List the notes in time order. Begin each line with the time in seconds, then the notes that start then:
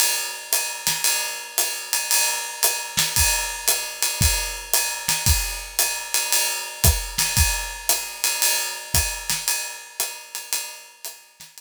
0.00 ride
0.53 hi-hat pedal, ride
0.87 snare, ride
1.04 ride
1.58 hi-hat pedal, ride
1.93 ride
2.11 ride
2.63 hi-hat pedal, ride
2.97 snare, ride
3.16 kick, ride
3.68 hi-hat pedal, ride
4.03 ride
4.21 kick, ride
4.73 hi-hat pedal, ride
5.08 snare, ride
5.26 kick, ride
5.79 hi-hat pedal, ride
6.14 ride
6.32 ride
6.84 kick, hi-hat pedal, ride
7.18 snare, ride
7.37 kick, ride
7.89 hi-hat pedal, ride
8.24 ride
8.42 ride
8.94 kick, hi-hat pedal, ride
9.30 snare, ride
9.48 ride
10.00 hi-hat pedal, ride
10.35 ride
10.53 ride
11.05 hi-hat pedal, ride
11.40 snare, ride
11.58 ride